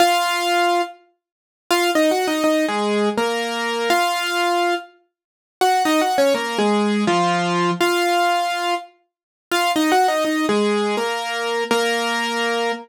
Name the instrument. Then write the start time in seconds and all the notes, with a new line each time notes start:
acoustic grand piano
0.00 F4 F5
1.71 F4 F5
1.95 D#4 D#5
2.11 F#4 F#5
2.28 D#4 D#5
2.44 D#4 D#5
2.68 G#3 G#4
3.17 A#3 A#4
3.90 F4 F5
5.61 F#4 F#5
5.85 D#4 D#5
6.01 F#4 F#5
6.18 C#4 C#5
6.34 A#3 A#4
6.58 G#3 G#4
7.07 F3 F4
7.81 F4 F5
9.51 F4 F5
9.76 D#4 D#5
9.92 F#4 F#5
10.08 D#4 D#5
10.25 D#4 D#5
10.49 G#3 G#4
10.97 A#3 A#4
11.71 A#3 A#4